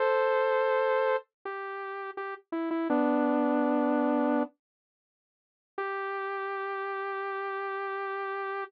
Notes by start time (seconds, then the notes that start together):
0.00 A4 C5
1.45 G4
2.17 G4
2.52 E4
2.71 E4
2.90 B3 D4
5.78 G4